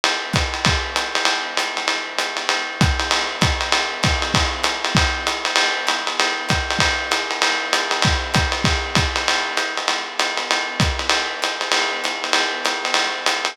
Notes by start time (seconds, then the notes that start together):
0.04 ride
0.33 kick, hi-hat pedal, ride
0.54 ride
0.65 kick, ride
0.96 hi-hat pedal, ride
1.15 ride
1.25 ride
1.57 hi-hat pedal, ride
1.77 ride
1.88 ride
2.19 hi-hat pedal, ride
2.37 ride
2.49 ride
2.81 kick, hi-hat pedal, ride
3.00 ride
3.11 ride
3.41 kick, hi-hat pedal, ride
3.61 ride
3.72 ride
4.03 kick, hi-hat pedal, ride
4.22 ride
4.34 kick, ride
4.64 hi-hat pedal, ride
4.85 ride
4.95 kick, ride
5.27 hi-hat pedal, ride
5.45 ride
5.56 ride
5.87 hi-hat pedal, ride
6.07 ride
6.20 ride
6.49 kick, hi-hat pedal, ride
6.71 ride
6.79 kick, ride
7.11 hi-hat pedal, ride
7.31 ride
7.42 ride
7.73 hi-hat pedal, ride
7.91 ride
8.02 kick, ride
8.34 kick, hi-hat pedal, ride
8.52 ride
8.64 kick, ride
8.95 kick, hi-hat pedal, ride
9.16 ride
9.28 ride
9.57 hi-hat pedal, ride
9.77 ride
9.88 ride
10.19 hi-hat pedal, ride
10.37 ride
10.51 ride
10.80 kick, hi-hat pedal, ride
10.99 ride
11.10 ride
11.42 hi-hat pedal, ride
11.61 ride
11.72 ride
12.04 hi-hat pedal, ride
12.24 ride
12.33 ride
12.65 hi-hat pedal, ride
12.85 ride
12.94 ride
13.26 hi-hat pedal, ride
13.45 ride